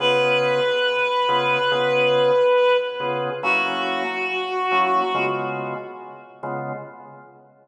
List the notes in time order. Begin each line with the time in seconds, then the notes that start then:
0.00 C#3 B3 F4 G#4 B4
1.29 C#3 B3 F4 G#4
1.71 C#3 B3 F4 G#4
3.00 C#3 B3 F4 G#4
3.43 F#3 A#3 C#4 E4 F#4
4.71 F#3 A#3 C#4 E4
5.14 C#3 G#3 B3 F4
6.43 C#3 G#3 B3 F4